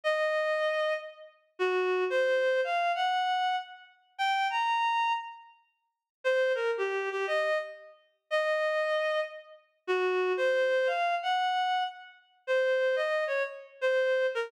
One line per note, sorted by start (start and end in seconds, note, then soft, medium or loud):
0.04 0.93 D#5 loud
1.59 2.04 F#4 loud
2.10 2.61 C5 loud
2.64 2.92 F5 loud
2.95 3.56 F#5 loud
4.18 4.48 G5 loud
4.50 5.13 A#5 loud
6.24 6.52 C5 loud
6.55 6.71 A#4 loud
6.77 7.09 G4 medium
7.11 7.26 G4 loud
7.27 7.58 D#5 loud
8.30 9.20 D#5 loud
9.87 10.33 F#4 loud
10.37 10.88 C5 loud
10.87 11.15 F5 loud
11.23 11.83 F#5 loud
12.47 12.95 C5 loud
12.96 13.24 D#5 loud
13.27 13.43 C#5 medium
13.81 14.26 C5 loud
14.35 14.51 A#4 loud